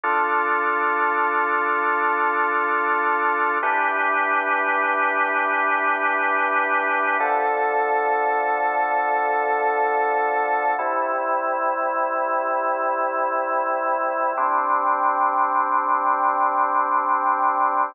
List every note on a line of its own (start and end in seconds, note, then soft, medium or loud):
0.04 3.58 D4 medium
0.04 3.58 F4 medium
0.04 3.58 A4 medium
3.63 7.17 E3 medium
3.63 7.17 D4 medium
3.63 7.17 G4 medium
3.63 7.17 B4 medium
7.20 10.75 D3 medium
7.20 10.75 F3 medium
7.20 10.75 A4 medium
10.79 14.33 C3 medium
10.79 14.33 G3 medium
10.79 14.33 E4 medium
14.37 17.92 G3 medium
14.37 17.92 C4 medium
14.37 17.92 D4 medium